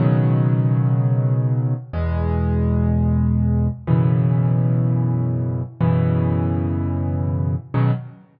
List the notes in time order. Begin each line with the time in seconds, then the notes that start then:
0.00 B2 C#3 D#3 F#3
1.93 E2 B2 G#3
3.87 F#2 B2 C#3 E3
5.81 F#2 B2 C#3 E3
7.74 B2 C#3 D#3 F#3